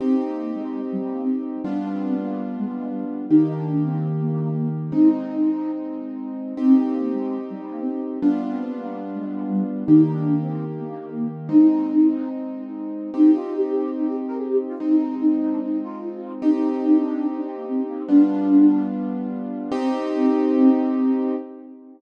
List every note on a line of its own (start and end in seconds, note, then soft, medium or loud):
0.00 0.22 C4 loud
0.00 1.62 C4 medium
0.00 1.62 D#4 medium
0.00 1.62 G4 medium
0.27 0.53 A#3 loud
0.55 0.80 G#3 loud
0.92 1.02 G3 medium
1.03 1.13 G3 loud
1.12 1.22 A#3 medium
1.23 1.43 C4 loud
1.64 3.26 G3 medium
1.64 3.26 B3 medium
1.64 3.26 D4 medium
1.64 1.88 D4 loud
1.64 3.26 F4 medium
1.92 2.15 C4 loud
2.20 2.42 A#3 loud
2.58 2.67 G#3 loud
2.67 2.77 G#3 medium
2.78 2.88 G#3 loud
2.87 3.04 G3 loud
3.29 4.92 D#3 medium
3.29 4.92 A#3 medium
3.29 3.54 D#4 loud
3.29 4.92 G4 medium
3.57 3.83 D4 loud
3.85 4.07 C4 loud
4.20 4.30 A#3 loud
4.31 4.41 A#3 loud
4.42 4.51 A#3 loud
4.51 4.69 A#3 loud
4.92 6.53 G#3 medium
4.92 6.53 C4 medium
4.92 6.53 D#4 medium
4.92 5.71 D#4 loud
6.57 8.18 C4 medium
6.57 6.81 C4 loud
6.57 8.18 D#4 medium
6.57 8.18 G4 medium
6.84 7.10 A#3 loud
7.13 7.38 G#3 loud
7.50 7.60 G3 medium
7.62 7.71 G3 loud
7.71 7.80 A#3 medium
7.81 8.01 C4 loud
8.21 9.84 G3 medium
8.21 9.84 B3 medium
8.21 8.44 D4 loud
8.21 9.84 D4 medium
8.21 9.84 F4 medium
8.51 8.73 C4 loud
8.77 8.99 A#3 loud
9.15 9.24 G#3 loud
9.25 9.34 G#3 medium
9.35 9.45 G#3 loud
9.45 9.63 G3 loud
9.86 11.49 D#3 medium
9.86 11.49 A#3 medium
9.86 10.11 D#4 loud
9.86 11.49 G4 medium
10.12 10.39 D4 loud
10.41 10.64 C4 loud
10.79 10.89 A#3 loud
10.90 10.99 A#3 loud
10.99 11.09 A#3 loud
11.10 11.28 A#3 loud
11.49 13.10 G#3 medium
11.49 13.10 C4 medium
11.49 13.10 D#4 medium
11.49 12.29 D#4 loud
13.14 14.75 C4 medium
13.14 14.75 D#4 medium
13.14 13.35 D#4 loud
13.14 14.75 G4 medium
13.35 13.54 F4 loud
13.57 13.91 G4 medium
13.97 14.07 D#4 loud
14.07 14.17 G4 loud
14.28 14.38 A#4 loud
14.38 14.47 G#4 loud
14.48 14.58 G4 loud
14.69 14.78 F4 loud
14.78 16.41 G#3 medium
14.78 16.41 C4 medium
14.78 15.15 D#4 loud
14.78 16.41 D#4 medium
15.21 15.40 D#4 loud
15.41 15.50 D#4 loud
15.52 15.61 D4 loud
15.62 15.80 D#4 loud
15.84 16.33 F4 loud
16.42 18.03 C4 medium
16.42 18.03 D#4 medium
16.42 16.67 D#4 loud
16.42 18.03 G4 medium
16.71 16.97 D#4 loud
17.00 17.26 D4 loud
17.36 17.46 D4 loud
17.46 17.56 C4 loud
17.56 17.66 A#3 loud
17.67 17.84 C4 loud
17.89 17.98 A#3 loud
17.98 18.08 C4 loud
18.08 19.70 G3 medium
18.08 19.70 B3 medium
18.08 18.87 D4 loud
18.08 19.70 D4 medium
18.08 19.70 F4 medium
19.72 21.35 C4 loud
19.72 21.36 C4 loud
19.72 21.35 D#4 loud
19.72 21.35 G4 loud